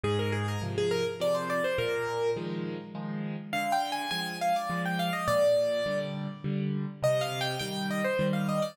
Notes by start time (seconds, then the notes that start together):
0.04 G#2 G#4
0.19 A#4
0.32 G#4
0.48 A#4
0.62 C3 F3
0.78 G#4
0.91 A#4
1.20 C3 F3 D5
1.35 C5
1.50 D5
1.64 C5
1.78 A#2 A#4
2.37 D#3 F3 G#3
2.95 D#3 F3 G#3
3.53 D3 F5
3.72 G5
3.92 G#5
4.11 F3 G#3 G#5
4.41 F5
4.56 D5
4.70 F3 G#3
4.86 G5
4.99 F5
5.13 D#5
5.28 A#2 D5
5.86 D3 G3
6.44 D3 G3
7.03 C3 D#5
7.21 F5
7.41 G5
7.59 D#3 G3 G5
7.91 D#5
8.04 C5
8.19 D#3 G3
8.33 F5
8.49 D#5
8.62 D5